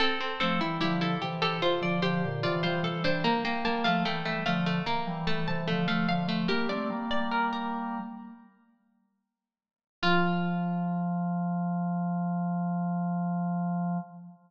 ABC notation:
X:1
M:4/4
L:1/16
Q:1/4=74
K:F
V:1 name="Pizzicato Strings"
A2 A2 G A2 A c d c2 d c A c | b g a f g e f2 b2 a a2 f f2 | "^rit." B d2 d B B9 z2 | F16 |]
V:2 name="Harpsichord"
C C C E E E G G F2 G2 F F2 D | B, B, B, A, A, A, A, A, B,2 A,2 A, A,2 A, | "^rit." G6 z10 | F16 |]
V:3 name="Drawbar Organ"
z2 [F,A,] [E,G,] [D,F,]2 [C,E,]2 z [D,F,] [D,F,] [B,,D,] [C,E,] [E,G,] [C,E,] [E,G,] | z2 [G,B,] [F,A,] [E,G,]2 [D,F,]2 z [E,G,] [E,G,] [C,E,] [D,F,] [F,A,] [D,F,] [F,A,] | "^rit." [G,B,] [A,C] [G,B,]6 z8 | F,16 |]